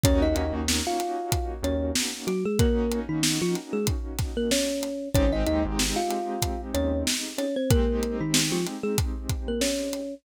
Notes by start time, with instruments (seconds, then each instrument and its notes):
0.04 synth bass 1 D#2, acoustic grand piano A#3 C#4 D#4 F#4, kalimba C#4 C#5, kick, closed hi-hat
0.22 kalimba D#4 D#5
0.36 synth bass 1 D#2, kalimba D#4 D#5, closed hi-hat
0.53 synth bass 1 D#2
0.68 snare
0.87 kalimba F4 F5
1.00 closed hi-hat
1.32 kick, closed hi-hat
1.63 synth bass 1 D#2, kalimba C#4 C#5, closed hi-hat
1.95 snare
2.27 kalimba F#3 F#4, closed hi-hat
2.45 kalimba G#3 G#4
2.59 kalimba A#3 A#4, acoustic grand piano A#3 C#4 D#4 F#4, kick, closed hi-hat
2.92 closed hi-hat
3.09 kalimba D#3 D#4
3.23 snare
3.42 kalimba F3 F4
3.55 closed hi-hat
3.73 kalimba G#3 G#4
3.87 kick, closed hi-hat
4.19 kick, snare, closed hi-hat
4.37 kalimba A#3 A#4
4.51 kalimba C#4 C#5, snare
4.83 closed hi-hat
5.15 synth bass 1 G#1, acoustic grand piano G#3 C4 D#4 G4, kalimba C#4 C#5, kick, closed hi-hat
5.33 kalimba D#4 D#5
5.47 synth bass 1 D#2, kalimba D#4 D#5, closed hi-hat
5.65 synth bass 1 G#1
5.79 snare
5.96 kalimba F4 F5
6.11 closed hi-hat
6.42 kick, closed hi-hat
6.74 synth bass 1 D#2, kalimba C#4 C#5, closed hi-hat
7.07 snare
7.38 kalimba C#4 C#5, closed hi-hat
7.56 kalimba C4 C5
7.70 acoustic grand piano G#3 C4 D#4 G4, kalimba A#3 A#4, kick, closed hi-hat
8.03 closed hi-hat
8.21 kalimba D#3 D#4
8.34 snare
8.52 kalimba F3 F4
8.67 closed hi-hat
8.83 kalimba G#3 G#4
8.98 kick, closed hi-hat
9.29 kick, closed hi-hat
9.48 kalimba A#3 A#4
9.61 kalimba C#4 C#5, snare
9.93 closed hi-hat